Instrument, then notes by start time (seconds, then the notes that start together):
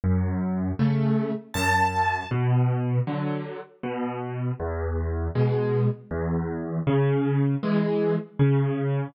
acoustic grand piano
0.04 F#2
0.79 C#3 A3
1.54 F#2 A5
2.31 B2
3.07 D3 F#3
3.83 B2
4.60 E2
5.35 B2 G#3
6.11 E2
6.87 C#3
7.63 E3 G#3
8.39 C#3